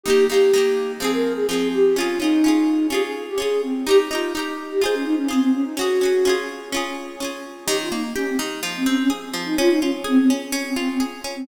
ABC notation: X:1
M:4/4
L:1/16
Q:1/4=126
K:Ebmix
V:1 name="Flute"
G2 G6 A B2 A A2 G2 | F2 E6 G A2 G A2 C2 | G z F2 z3 G A D E D C C D E | _G6 z10 |
G F E z D C z3 C D D z3 E | F E D z C C z3 C C C z3 C |]
V:2 name="Acoustic Guitar (steel)"
[E,B,G]2 [E,B,G]2 [E,B,G]4 [F,CA]4 [F,CA]4 | [DFA]2 [DFA]2 [DFA]4 [DFA]4 [DFA]4 | [EGB]2 [EGB]2 [EGB]4 [FAc]4 [FAc]4 | [D_GA]2 [DGA]2 [DFA]4 [DFA]4 [DFA]4 |
E,2 B,2 G2 E,2 F,2 C2 A2 F,2 | D2 F2 A2 D2 D2 F2 A2 D2 |]